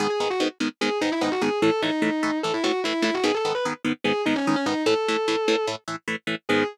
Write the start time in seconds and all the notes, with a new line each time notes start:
0.00 G#2 D#3 B3 G#4
0.10 G#4
0.20 G#2 D#3 B3
0.30 F#4
0.40 G#2 D#3 B3
0.60 G#2 D#3 B3
0.81 G#2 D#3 B3 G#4
1.01 G#2 D#3 B3 D#4
1.12 E4
1.21 G#2 D#3 B3 D#4
1.32 F#4
1.41 G#2 D#3 B3 G#4
1.62 A2 E3 A3 A4
1.82 A2 E3 A3 D#4
2.02 A2 E3 A3
2.23 A2 E3 A3
2.43 A2 E3 A3 A4
2.54 E4
2.64 A2 E3 A3 F#4
2.84 A2 E3 A3 E4
3.02 A2 E3 A3 E4
3.14 F#4
3.24 G#2 D#3 B3 G#4
3.35 A4
3.45 G#2 D#3 B3
3.55 B4
3.65 G#2 D#3 B3
3.84 G#2 D#3 B3
4.04 G#2 D#3 B3 G#4
4.26 G#2 D#3 B3 D#4
4.36 C#4
4.46 G#2 D#3 B3 C#4
4.56 C#4
4.66 G#2 D#3 B3 D#4
4.86 A2 E3 A3 A4
5.08 A2 E3 A3
5.28 A2 E3 A3
5.48 A2 E3 A3
5.67 A2 E3 A3
5.88 A2 E3 A3
6.08 A2 E3 A3
6.27 A2 E3 A3
6.49 G#2 D#3 B3 G#4